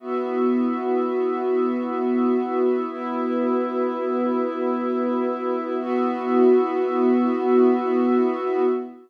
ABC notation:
X:1
M:4/4
L:1/8
Q:1/4=83
K:B
V:1 name="Pad 2 (warm)"
[B,EF]8 | [B,FB]8 | [B,EF]8 |]
V:2 name="Pad 5 (bowed)"
[B,Fe]8 | [B,Ee]8 | [B,Fe]8 |]